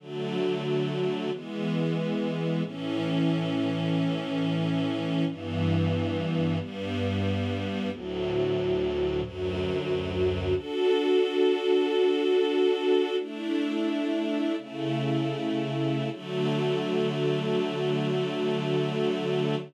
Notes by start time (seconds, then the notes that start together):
0.00 D3 F#3 A3
1.32 E3 G#3 B3
2.64 A2 E3 C#4
5.27 G2 E3 B3
6.59 G2 G3 B3
7.91 D2 A2 F#3
9.23 D2 F#2 F#3
10.55 D4 F#4 A4
13.19 A3 D4 E4
14.57 C#3 A3 E4
16.11 D3 F#3 A3